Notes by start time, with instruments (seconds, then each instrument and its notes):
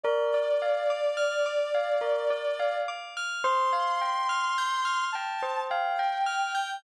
0.04 tubular bells A#4, ocarina D5
0.34 tubular bells D5
0.62 tubular bells F5
0.90 tubular bells D6
1.17 tubular bells F6
1.46 tubular bells D6
1.75 tubular bells F5
2.01 tubular bells A#4
2.30 tubular bells D5
2.59 tubular bells F5
2.88 tubular bells D6
3.17 tubular bells F6
3.44 tubular bells C5, ocarina C6
3.73 tubular bells F5
4.01 tubular bells G5
4.29 tubular bells F6
4.58 tubular bells G6
4.85 tubular bells F6
5.12 tubular bells G5, ocarina A5
5.42 tubular bells C5
5.70 tubular bells F5, ocarina G5
5.99 tubular bells G5
6.26 tubular bells F6
6.55 tubular bells G6